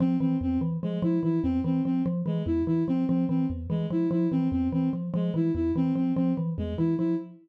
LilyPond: <<
  \new Staff \with { instrumentName = "Xylophone" } { \clef bass \time 7/8 \tempo 4 = 146 f8 e8 e,8 e8 f8 f8 e8 | e,8 e8 f8 f8 e8 e,8 e8 | f8 f8 e8 e,8 e8 f8 f8 | e8 e,8 e8 f8 f8 e8 e,8 |
e8 f8 f8 e8 e,8 e8 f8 | }
  \new Staff \with { instrumentName = "Violin" } { \time 7/8 c'8 c'8 c'8 r8 gis8 e'8 e'8 | c'8 c'8 c'8 r8 gis8 e'8 e'8 | c'8 c'8 c'8 r8 gis8 e'8 e'8 | c'8 c'8 c'8 r8 gis8 e'8 e'8 |
c'8 c'8 c'8 r8 gis8 e'8 e'8 | }
>>